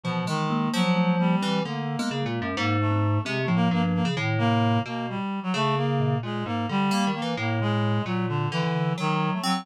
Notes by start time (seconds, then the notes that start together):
0.04 B2 E3 F3
0.27 D#3 G#3
0.50 A#3
0.73 F3 F#3
0.96 A3
1.19 G3 A#3
1.42 E3 C4
1.65 D3 A3 A#3
1.99 G#3 B3
2.11 C#3
2.22 A#2 G#3
2.42 F#2
2.56 G#2 A#3
2.80 A3
2.91 C4
3.25 C3 G#3 C4
3.42 A3
3.48 A2 F3
3.55 A#3
3.71 G2 A#3
3.83 A#3
3.95 A#3
4.05 C#3
4.17 A2 D#3
4.38 C3 A#3
4.85 B2 A#3
5.09 G3
5.43 F#3
5.54 C#3 A3
5.76 A#3
6.00 A#2
6.23 A#2 G#3
6.46 G#2 A#3
6.69 D3 G3
6.91 A#3
7.07 D#3
7.14 A#3
7.22 E3
7.37 A2 A#3
7.60 B2 G#3
8.05 A#2 F#3
8.28 D3
8.52 D3 E3
8.63 D3
8.98 D#3 F#3
9.33 A3
9.43 F#3 C4